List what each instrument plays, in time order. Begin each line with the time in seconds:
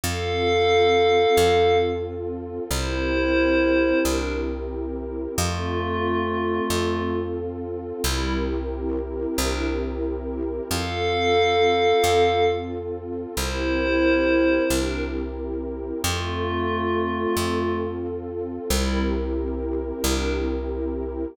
0.03 electric bass (finger) F2, pad 2 (warm) C4 F4 A4, pad 5 (bowed) A4 F5
1.37 electric bass (finger) F2
2.71 electric bass (finger) C2, pad 2 (warm) C4 E4 G4 A#4, pad 5 (bowed) E4 C5
4.03 electric bass (finger) C2, pad 5 (bowed) D4 A#4
5.37 electric bass (finger) F2, pad 5 (bowed) A3 F4, pad 2 (warm) C4 F4 A4
6.70 electric bass (finger) F2
8.04 electric bass (finger) C2, pad 5 (bowed) G3 E4, pad 2 (warm) C4 E4 G4 A#4
9.38 electric bass (finger) C2, pad 5 (bowed) D4 A#4
10.70 electric bass (finger) F2, pad 2 (warm) C4 F4 A4, pad 5 (bowed) A4 F5
12.04 electric bass (finger) F2
13.36 electric bass (finger) C2, pad 2 (warm) C4 E4 G4 A#4, pad 5 (bowed) E4 C5
14.70 electric bass (finger) C2, pad 5 (bowed) D4 A#4
16.04 electric bass (finger) F2, pad 5 (bowed) A3 F4, pad 2 (warm) C4 F4 A4
17.37 electric bass (finger) F2
18.70 electric bass (finger) C2, pad 5 (bowed) G3 E4, pad 2 (warm) C4 E4 G4 A#4
20.03 electric bass (finger) C2, pad 5 (bowed) D4 A#4